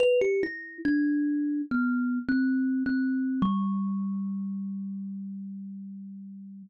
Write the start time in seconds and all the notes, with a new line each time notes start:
0.00 B4
0.21 G4
0.43 E4
0.85 D4
1.71 B3
2.29 C4
2.86 C4
3.42 G3